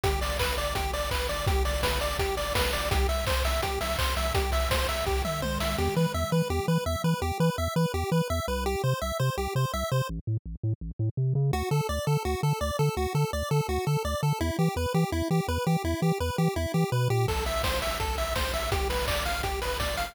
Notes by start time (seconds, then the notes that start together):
0.04 G1 G4, kick, closed hi-hat
0.21 G1 D5, open hi-hat
0.39 G1 B4, kick, clap
0.57 G1 D5, open hi-hat
0.75 G1 G4, kick, closed hi-hat
0.93 G1 D5, open hi-hat
1.11 G1 B4, kick, clap
1.29 G1 D5, open hi-hat
1.47 G1 G4, kick, closed hi-hat
1.65 G1 D5, open hi-hat
1.83 G1 B4, kick, snare
2.01 G1 D5, open hi-hat
2.19 G1 G4, kick, closed hi-hat
2.37 G1 D5, open hi-hat
2.55 G1 B4, kick, snare
2.73 G1 D5, open hi-hat
2.91 C2 G4, kick, closed hi-hat
3.09 C2 E5, open hi-hat
3.27 C2 C5, kick, clap
3.45 C2 E5, open hi-hat
3.62 C2 G4, kick, closed hi-hat
3.81 C2 E5, open hi-hat
3.99 C2 C5, kick, clap
4.16 C2 E5, open hi-hat
4.35 C2 G4, kick, closed hi-hat
4.52 C2 E5, open hi-hat
4.71 C2 C5, kick, snare
4.89 C2 E5, open hi-hat
5.06 C2 G4, kick
5.24 C2 E5, mid tom
5.42 C2 C5, high tom
5.60 C2 E5, snare
5.78 E2 G4
5.96 E3 B4
6.14 E2 E5
6.32 E3 B4
6.50 E2 G4
6.68 E3 B4
6.86 E2 E5
7.04 E3 B4
7.22 E2 G4
7.40 E3 B4
7.58 E2 E5
7.76 E3 B4
7.94 E2 G4
8.12 E3 B4
8.30 E2 E5
8.48 C2 B4
8.66 G4
8.84 C3 C5
9.01 C2 E5
9.20 C3 C5
9.38 C2 G4
9.55 C3 C5
9.74 C2 E5
9.92 C3 C5
10.09 A1
10.27 A2
10.46 A1
10.63 A2
10.81 A1
10.99 A2
11.17 C3
11.35 C#3
11.53 D2 F#4
11.71 D3 A4
11.89 D2 D5
12.07 D3 A4
12.25 D2 F#4
12.43 D3 A4
12.61 D2 D5
12.79 D3 A4
12.97 D2 F#4
13.15 D3 A4
13.33 D2 D5
13.51 D3 A4
13.69 D2 F#4
13.87 D3 A4
14.05 D2 D5
14.23 D3 A4
14.41 E2 E4
14.59 E3 G4
14.76 E2 B4
14.94 E3 G4
15.12 E2 E4
15.31 E3 G4
15.48 E2 B4
15.67 E3 G4
15.84 E2 E4
16.02 E3 G4
16.20 E2 B4
16.38 E3 G4
16.56 E2 E4
16.74 E3 G4
16.92 B2 B4
17.10 A#2 G4
17.28 A1 A4, kick, crash
17.46 A1 E5, open hi-hat
17.63 A1 C5, kick, snare
17.82 A1 E5, open hi-hat
18.00 A1 A4, kick, closed hi-hat
18.18 A1 E5, open hi-hat
18.36 A1 C5, kick, snare
18.54 A1 E5, open hi-hat
18.72 G1 G4, kick, closed hi-hat
18.90 G1 B4, open hi-hat
19.08 G1 D5, kick, clap
19.25 G1 F5, open hi-hat
19.43 G1 G4, kick, closed hi-hat
19.62 G1 B4, open hi-hat
19.80 G1 D5, kick, snare
19.97 G1 F5, open hi-hat